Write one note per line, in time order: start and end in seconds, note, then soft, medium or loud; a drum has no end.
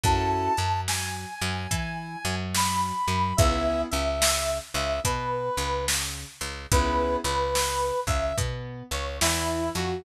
0.03 0.49 F#2 loud
0.03 0.52 C#4 loud
0.03 0.52 E4 loud
0.03 0.52 F#4 loud
0.03 0.52 A4 loud
0.03 0.81 A5 medium
0.03 kick loud
0.03 closed hi-hat medium
0.57 1.26 F#2 medium
0.57 1.25 F#3 medium
0.57 closed hi-hat medium
0.88 2.35 G#5 medium
0.88 snare medium
1.41 1.67 F#2 loud
1.41 1.68 F#3 loud
1.41 closed hi-hat medium
1.71 2.16 E3 loud
1.71 2.16 E4 medium
1.71 kick medium
1.71 closed hi-hat loud
2.25 2.92 F#2 loud
2.25 2.92 F#3 loud
2.25 closed hi-hat medium
2.55 3.36 B5 medium
2.55 snare loud
3.07 3.33 F#2 medium
3.07 3.33 F#3 medium
3.07 closed hi-hat medium
3.37 3.84 C#2 loud
3.37 3.86 B3 loud
3.37 3.86 C#4 loud
3.37 3.86 E4 loud
3.37 3.86 G#4 loud
3.37 3.81 E5 medium
3.37 kick loud
3.37 closed hi-hat loud
3.91 4.60 C#2 loud
3.91 4.59 C#3 medium
3.91 4.58 E5 medium
3.91 closed hi-hat medium
4.22 snare loud
4.74 5.00 C#2 loud
4.74 5.01 C#3 loud
4.74 5.00 E5 medium
4.74 closed hi-hat medium
5.04 5.50 B2 loud
5.04 5.49 B3 medium
5.04 5.85 B4 medium
5.04 kick medium
5.04 closed hi-hat loud
5.57 6.25 C#2 loud
5.57 6.25 C#3 medium
5.57 closed hi-hat medium
5.88 snare loud
6.41 6.66 C#2 medium
6.41 6.66 C#3 medium
6.41 closed hi-hat medium
6.72 7.17 C#2 loud
6.72 7.19 B3 loud
6.72 7.19 C#4 medium
6.72 7.19 E4 loud
6.72 7.19 G#4 loud
6.72 7.16 B4 medium
6.72 kick medium
6.72 closed hi-hat loud
7.24 7.92 C#2 loud
7.24 7.93 C#3 medium
7.24 8.00 B4 medium
7.24 closed hi-hat medium
7.55 snare loud
8.07 8.33 C#2 medium
8.07 8.34 C#3 medium
8.07 8.36 E5 medium
8.07 kick medium
8.07 closed hi-hat medium
8.37 8.83 B2 loud
8.37 8.83 B3 medium
8.37 kick medium
8.37 closed hi-hat loud
8.91 9.20 C#2 medium
8.91 9.20 C#3 medium
8.91 9.17 C#5 medium
8.91 closed hi-hat medium
9.21 9.70 E2 loud
9.21 9.70 E3 medium
9.21 9.69 E4 medium
9.21 snare loud
9.75 10.02 F2 loud
9.75 10.02 F3 medium
9.75 10.02 F#4 medium
9.75 closed hi-hat medium